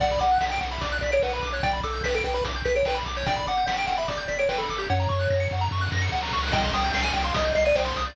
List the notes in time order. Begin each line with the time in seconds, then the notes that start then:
0.00 B1 D5 F#5, kick, crash
0.10 B5, kick, closed hi-hat
0.19 B1 F#5 D6, closed hi-hat
0.31 F#6, closed hi-hat
0.41 B1 F#5 B6, snare
0.50 G5 D7, closed hi-hat
0.60 B1 F#5, closed hi-hat
0.71 E5 B5, closed hi-hat
0.81 B1 D5 D6, kick, closed hi-hat
0.92 F#6, closed hi-hat
1.01 B1 D5 B6, closed hi-hat
1.12 C#5 D7, closed hi-hat
1.22 B1 B4 F#5, snare
1.33 B4 B5, closed hi-hat
1.42 B1 D6, closed hi-hat
1.53 C#5 F#6, closed hi-hat
1.63 B1 D5 G5, kick, closed hi-hat
1.73 B5, closed hi-hat
1.83 B1 A4 D6, closed hi-hat
1.93 G6, closed hi-hat
2.04 B1 B4 B6, snare
2.14 A4 D7, closed hi-hat
2.24 B1 B4 G5, closed hi-hat
2.34 B4 B5, closed hi-hat
2.45 B1 D6, kick, closed hi-hat
2.55 G6, closed hi-hat
2.65 B1 B4 B6, closed hi-hat
2.75 C#5 D7, closed hi-hat
2.85 B1 B4 G5, snare
2.95 B5, closed hi-hat
3.05 B1 D6, closed hi-hat
3.16 C#5 G6, closed hi-hat
3.26 G1 D5 G5, kick, closed hi-hat
3.36 B5, kick, closed hi-hat
3.47 G1 F#5 D6, closed hi-hat
3.57 G6, closed hi-hat
3.66 G1 F#5 B6, snare
3.76 G5 D7, closed hi-hat
3.87 G1 F#5 G5, closed hi-hat
3.98 E5 B5, closed hi-hat
4.08 G1 D5 D6, kick, closed hi-hat
4.18 G6, closed hi-hat
4.28 G1 D5 B6, closed hi-hat
4.39 C#5 D7, closed hi-hat
4.49 G1 B4 G5, snare
4.58 A4 B5, closed hi-hat
4.69 G1 D6, closed hi-hat
4.78 G4 G6, closed hi-hat
4.90 F#2 C#5 F#5, kick, snare
5.00 A#5, snare
5.09 F#2 C#6, snare
5.19 F#6, snare
5.30 F#2 A#6, snare
5.40 C#7, snare
5.51 F#2 F#5, snare
5.61 A#5, snare
5.71 F#2 C#6, snare
5.77 snare
5.81 F#6, snare
5.86 snare
5.92 F#2 A#6, snare
5.97 snare
6.02 C#7, snare
6.07 snare
6.12 D2 F#5, snare
6.17 snare
6.22 A#5, snare
6.28 snare
6.33 C#2 C#6, snare
6.38 snare
6.43 F#6, snare
6.48 snare
6.52 C2 D#5 G5, kick, crash
6.63 C6, kick, closed hi-hat
6.73 C2 G5 D#6, closed hi-hat
6.84 G6, closed hi-hat
6.93 C2 G5 C7, snare
7.03 G#5 D#7, closed hi-hat
7.13 C2 G5, closed hi-hat
7.24 F5 C6, closed hi-hat
7.34 C2 D#5 D#6, kick, closed hi-hat
7.45 G6, closed hi-hat
7.55 C2 D#5 C7, closed hi-hat
7.65 D5 D#7, closed hi-hat
7.75 C2 C5 G5, snare
7.85 C5 C6, closed hi-hat
7.96 C2 D#6, closed hi-hat
8.06 D5 G6, closed hi-hat